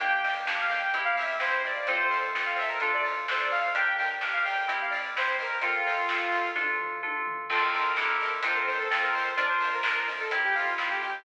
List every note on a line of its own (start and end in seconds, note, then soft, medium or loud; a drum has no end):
0.00 0.86 G1 loud
0.00 0.21 A#3 medium
0.00 0.41 A#3 medium
0.00 0.41 D4 medium
0.00 0.21 D4 medium
0.00 0.41 G4 medium
0.00 0.22 G5 medium
0.00 kick loud
0.00 closed hi-hat loud
0.04 0.21 G4 medium
0.23 0.67 A#3 medium
0.23 0.34 G5 medium
0.23 open hi-hat medium
0.27 0.67 D4 medium
0.27 0.67 G4 medium
0.47 0.89 A#3 medium
0.47 0.89 D4 medium
0.47 0.89 G4 medium
0.47 kick medium
0.47 snare loud
0.61 0.72 F5 medium
0.70 0.91 A#3 medium
0.70 0.91 D4 medium
0.70 1.02 G5 medium
0.70 open hi-hat medium
0.75 0.91 G4 medium
0.93 1.80 E2 loud
0.93 1.36 C4 loud
0.93 1.81 C4 medium
0.93 1.36 E4 loud
0.93 1.81 E4 medium
0.93 1.36 G4 medium
0.93 kick medium
0.93 closed hi-hat loud
1.00 1.81 G4 medium
1.05 1.16 F5 medium
1.17 1.36 E5 medium
1.17 open hi-hat medium
1.40 1.82 C4 medium
1.40 1.82 E4 medium
1.40 1.82 G4 medium
1.40 1.62 C5 medium
1.40 kick medium
1.40 snare loud
1.64 1.87 D5 medium
1.64 open hi-hat medium
1.86 2.74 F2 loud
1.86 2.09 C4 medium
1.86 2.30 C4 medium
1.86 2.30 F4 loud
1.86 2.30 A4 loud
1.86 1.98 C5 medium
1.86 kick loud
1.86 closed hi-hat medium
1.90 2.09 F4 medium
1.90 2.09 A4 medium
1.99 2.18 C5 medium
2.11 2.54 C4 medium
2.11 2.54 F4 medium
2.11 open hi-hat medium
2.16 2.54 A4 medium
2.34 2.77 C4 medium
2.34 2.77 F4 medium
2.34 2.77 A4 medium
2.34 kick medium
2.34 snare loud
2.45 2.56 F5 medium
2.56 2.78 C4 medium
2.56 2.78 F4 medium
2.56 2.69 E5 medium
2.56 open hi-hat medium
2.62 2.78 A4 medium
2.68 2.79 A#4 medium
2.80 3.67 D2 loud
2.80 3.67 D4 medium
2.80 3.24 D4 medium
2.80 3.24 F4 medium
2.80 3.67 F4 medium
2.80 2.91 A4 medium
2.80 3.24 A4 medium
2.80 kick medium
2.80 closed hi-hat medium
2.86 3.67 A4 medium
2.94 3.05 D5 medium
3.05 open hi-hat medium
3.28 3.71 D4 medium
3.28 3.71 F4 medium
3.28 3.71 A4 medium
3.28 3.41 C5 medium
3.28 kick medium
3.28 snare loud
3.40 3.51 D5 medium
3.51 3.74 F5 medium
3.51 open hi-hat medium
3.75 4.61 G1 loud
3.75 4.18 D4 medium
3.75 3.97 D4 medium
3.75 4.18 G4 loud
3.75 3.97 G4 medium
3.75 4.18 A#4 medium
3.75 3.96 G5 medium
3.75 kick loud
3.75 closed hi-hat loud
3.81 3.97 A#4 medium
3.98 4.43 D4 medium
3.98 4.10 G5 medium
3.98 open hi-hat medium
4.02 4.43 G4 medium
4.02 4.43 A#4 medium
4.21 4.64 D4 medium
4.21 4.64 G4 medium
4.21 4.64 A#4 medium
4.21 kick medium
4.21 snare loud
4.33 4.44 F5 medium
4.44 4.67 D4 medium
4.44 4.73 G5 medium
4.44 open hi-hat medium
4.48 4.67 G4 medium
4.48 4.67 A#4 medium
4.68 5.55 C2 loud
4.68 5.10 C4 loud
4.68 5.55 C4 medium
4.68 5.10 E4 medium
4.68 5.55 E4 medium
4.68 5.10 G4 medium
4.68 kick medium
4.68 closed hi-hat loud
4.74 5.55 G4 medium
4.81 4.92 F5 medium
4.90 5.09 D5 medium
4.90 open hi-hat medium
5.15 5.58 C4 medium
5.15 5.58 E4 medium
5.15 5.58 G4 medium
5.15 5.37 C5 medium
5.15 kick medium
5.15 snare loud
5.39 5.64 A#4 medium
5.39 open hi-hat medium
5.62 6.50 F2 loud
5.62 5.84 C4 medium
5.62 6.05 C4 medium
5.62 6.51 F4 medium
5.62 6.05 F4 medium
5.62 5.84 F4 medium
5.62 6.05 A4 loud
5.62 kick loud
5.62 closed hi-hat loud
5.68 5.84 A4 medium
5.87 6.30 C4 medium
5.87 6.30 F4 medium
5.87 open hi-hat medium
5.92 6.30 A4 medium
6.09 6.52 C4 medium
6.09 6.52 F4 medium
6.09 6.52 A4 medium
6.09 kick medium
6.09 snare loud
6.32 6.54 C4 medium
6.32 6.54 F4 medium
6.32 open hi-hat medium
6.38 6.54 A4 medium
6.56 7.42 D2 loud
6.56 6.98 D4 medium
6.56 7.42 D4 medium
6.56 6.98 F4 loud
6.56 7.42 F4 medium
6.56 6.98 A4 medium
6.56 kick medium
6.56 high tom medium
6.61 7.42 A4 medium
6.79 floor tom medium
7.03 7.45 D4 medium
7.03 7.45 F4 medium
7.03 7.45 A4 medium
7.03 high tom medium
7.27 floor tom loud
7.50 7.93 F2 loud
7.50 7.92 C4 medium
7.50 7.72 C4 medium
7.50 7.92 F4 loud
7.50 7.72 F4 medium
7.50 7.92 A4 loud
7.50 7.62 A4 medium
7.50 kick loud
7.50 crash loud
7.55 7.72 A4 medium
7.61 8.28 A#4 medium
7.74 7.96 C4 medium
7.74 7.96 F4 medium
7.74 open hi-hat medium
7.80 7.96 A4 medium
7.96 8.40 F2 loud
7.96 8.18 D4 medium
7.96 8.39 D4 medium
7.96 8.39 E4 medium
7.96 8.18 E4 medium
7.96 8.39 G4 medium
7.96 8.39 A4 loud
7.96 kick medium
7.96 snare loud
8.02 8.18 G4 medium
8.02 8.18 A4 medium
8.20 8.42 D4 medium
8.20 8.42 E4 medium
8.20 open hi-hat medium
8.25 8.42 G4 medium
8.25 8.42 A4 medium
8.43 8.87 F2 loud
8.43 8.87 C4 medium
8.43 8.86 C4 medium
8.43 8.86 D4 medium
8.43 8.87 D4 medium
8.43 8.86 F4 medium
8.43 8.86 A4 loud
8.43 8.57 C5 medium
8.43 kick medium
8.43 closed hi-hat loud
8.49 8.87 F4 medium
8.49 8.87 A4 medium
8.55 8.66 A#4 medium
8.67 8.78 C5 medium
8.67 open hi-hat medium
8.79 9.00 A4 medium
8.90 9.34 F2 loud
8.90 9.33 C4 medium
8.90 9.35 C4 medium
8.90 9.33 F4 medium
8.90 9.33 A4 medium
8.90 kick medium
8.90 snare loud
8.94 9.35 F4 medium
8.94 9.35 A4 medium
9.02 9.13 A#4 medium
9.12 9.33 C5 medium
9.12 open hi-hat medium
9.37 10.24 F2 loud
9.37 9.79 D4 loud
9.37 9.59 D4 medium
9.37 9.79 F4 loud
9.37 9.59 F4 medium
9.37 9.79 A#4 medium
9.37 9.48 D5 medium
9.37 kick loud
9.37 closed hi-hat loud
9.43 9.59 A#4 medium
9.49 9.68 C5 medium
9.60 10.05 D4 medium
9.60 10.05 F4 medium
9.60 open hi-hat medium
9.67 10.05 A#4 medium
9.74 9.93 A#4 medium
9.83 10.27 D4 medium
9.83 10.27 F4 medium
9.83 10.27 A#4 medium
9.83 kick medium
9.83 snare loud
9.95 10.06 A#4 medium
10.08 10.29 D4 medium
10.08 10.29 F4 medium
10.08 open hi-hat medium
10.13 10.29 A#4 medium
10.20 10.31 A4 medium
10.30 11.17 F2 loud
10.30 10.74 C4 medium
10.30 11.18 C4 medium
10.30 10.74 E4 loud
10.30 11.18 E4 medium
10.30 10.74 G4 medium
10.30 kick medium
10.30 closed hi-hat loud
10.37 11.18 G4 medium
10.44 10.55 G4 medium
10.55 10.74 F4 medium
10.55 open hi-hat medium
10.78 11.20 C4 medium
10.78 11.20 E4 medium
10.78 10.90 F4 medium
10.78 11.20 G4 medium
10.78 kick medium
10.78 snare loud
10.90 11.01 G4 medium
11.02 11.24 G4 medium
11.02 open hi-hat medium